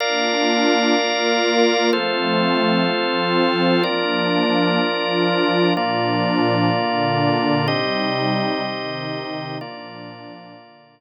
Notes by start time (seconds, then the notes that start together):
0.00 A#3 D4 F4 A#4 D5 F5
0.95 A#3 F4 A#4
1.92 F3 A3 C4 F4 A4 C5
2.89 F3 C4 F4
3.83 F3 A#3 D4 F4 A#4 D5
4.79 F3 D4 F4
5.75 A#2 F3 A#3 D4 F4 D5
6.72 A#2 D3 D4
7.67 C3 G3 C4 D#4 G4 D#5
8.64 C3 D#3 D#4
9.59 A#2 F3 A#3 D4 F4 D5
10.55 A#2 D3 D4